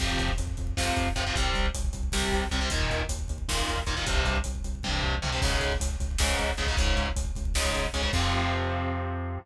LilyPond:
<<
  \new Staff \with { instrumentName = "Overdriven Guitar" } { \clef bass \time 7/8 \key f \minor \tempo 4 = 155 <c f>2 <c f>4 <c f>16 <c f>16 | <c g>2 <c g>4 <c g>16 <c g>16 | <bes, ees>2 <bes, ees>4 <bes, ees>16 <bes, ees>16 | <g, c>2 <g, c>4 <g, c>16 <g, c>16 |
<aes, des>2 <aes, des>4 <aes, des>16 <aes, des>16 | <aes, des>2 <aes, des>4 <aes, des>16 <aes, des>16 | <c f>2.~ <c f>8 | }
  \new Staff \with { instrumentName = "Synth Bass 1" } { \clef bass \time 7/8 \key f \minor f,8 f,8 f,8 f,8 f,8 f,8 f,8 | c,8 c,8 c,8 c,8 c,8 c,8 c,8 | ees,8 ees,8 ees,8 ees,8 ees,8 ees,8 ees,8 | c,8 c,8 c,8 c,8 c,8 c,8 c,8 |
des,8 des,8 des,8 des,8 des,8 des,8 des,8 | des,8 des,8 des,8 des,8 des,8 des,8 des,8 | f,2.~ f,8 | }
  \new DrumStaff \with { instrumentName = "Drums" } \drummode { \time 7/8 <cymc bd>16 bd16 <hh bd>16 bd16 <hh bd>16 bd16 <hh bd>16 bd16 <bd sn>16 bd16 <hh bd>16 bd16 <hh bd>16 bd16 | <hh bd>16 bd16 <hh bd>16 bd16 <hh bd>16 bd16 <hh bd>16 bd16 <bd sn>16 bd16 <hh bd>16 bd16 <hh bd>16 bd16 | <hh bd>16 bd16 <hh bd>16 bd16 <hh bd>16 bd16 <hh bd>16 bd16 <bd sn>16 bd16 <hh bd>16 bd16 <hh bd>16 bd16 | <hh bd>16 bd16 <hh bd>16 bd16 <hh bd>16 bd16 <hh bd>16 bd16 <bd tommh>8 tomfh8 toml8 |
<cymc bd>16 bd16 <hh bd>16 bd16 <hh bd>16 bd16 <hh bd>16 bd16 <bd sn>16 bd16 <hh bd>16 bd16 <hh bd>16 bd16 | <hh bd>16 bd16 <hh bd>16 bd16 <hh bd>16 bd16 <hh bd>16 bd16 <bd sn>16 bd16 <hh bd>16 bd16 <hh bd>16 bd16 | <cymc bd>4 r4 r4. | }
>>